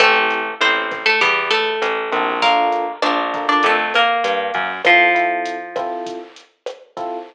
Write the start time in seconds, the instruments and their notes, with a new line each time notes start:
0.00 electric bass (finger) A1, acoustic guitar (steel) A3 A4, electric piano 1 C4 E4 G4 A4, kick, cross-stick, closed hi-hat
0.30 closed hi-hat
0.60 electric bass (finger) A1, acoustic guitar (steel) C4 C5, closed hi-hat
0.91 kick, cross-stick, closed hi-hat
1.06 acoustic guitar (steel) A3 A4
1.21 electric bass (finger) E2, acoustic guitar (steel) G3 G4, kick, closed hi-hat
1.51 acoustic guitar (steel) A3 A4, closed hi-hat
1.82 electric bass (finger) A1, cross-stick, closed hi-hat
2.11 electric bass (finger) A#1, electric piano 1 C4 E4 G4 A4, kick, closed hi-hat
2.42 acoustic guitar (steel) A#3 A#4, electric piano 1 D4 F4 A4 A#4, kick, closed hi-hat
2.72 closed hi-hat
3.02 electric bass (finger) A#1, acoustic guitar (steel) D4 D5, cross-stick, closed hi-hat
3.34 electric piano 1 D4 F4 A4 A#4, kick, closed hi-hat
3.49 acoustic guitar (steel) D4 D5
3.63 electric bass (finger) F2, acoustic guitar (steel) A3 A4, kick, closed hi-hat
3.94 acoustic guitar (steel) A#3 A#4, cross-stick, closed hi-hat
4.24 electric bass (finger) G2, closed hi-hat
4.54 electric bass (finger) F#2, kick, closed hi-hat
4.85 acoustic guitar (steel) F3 F4, electric piano 1 C4 E4 F4 A4, kick, cross-stick, closed hi-hat
5.15 electric piano 1 C4 E4 F4 A4, closed hi-hat
5.45 closed hi-hat
5.76 electric piano 1 C4 E4 F4 A4, kick, cross-stick, closed hi-hat
6.06 kick, closed hi-hat
6.36 closed hi-hat
6.66 cross-stick, closed hi-hat
6.97 electric piano 1 C4 E4 F4 A4, kick, closed hi-hat